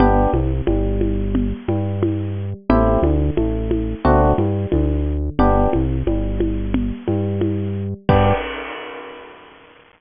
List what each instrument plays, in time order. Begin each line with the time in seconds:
0.00 synth bass 1 G1, electric piano 1 B3 D4 G4, low conga
0.33 synth bass 1 C2, electric piano 1 C3, high conga
0.67 synth bass 1 G1, electric piano 1 G3, high conga
1.01 high conga
1.35 low conga
1.68 synth bass 1 G2, electric piano 1 G3, high conga
2.03 high conga
2.69 synth bass 1 A1, electric piano 1 A3 C4 E4 G4, low conga
3.02 synth bass 1 D2, electric piano 1 D3, high conga
3.37 synth bass 1 A1, electric piano 1 A3, high conga
3.71 high conga
4.05 synth bass 1 D2, electric piano 1 A3 C4 D4 F#4, low conga
4.38 synth bass 1 G2, electric piano 1 G3, high conga
4.72 synth bass 1 D2, electric piano 1 D3, high conga
5.39 synth bass 1 G1, electric piano 1 B3 D4 G4, low conga
5.73 synth bass 1 C2, electric piano 1 C3, high conga
6.07 synth bass 1 G1, electric piano 1 G3, high conga
6.40 high conga
6.74 low conga
7.08 synth bass 1 G2, electric piano 1 G3, high conga
7.41 high conga
8.09 synth bass 1 G2, electric piano 1 B3 D4 G4, kick, crash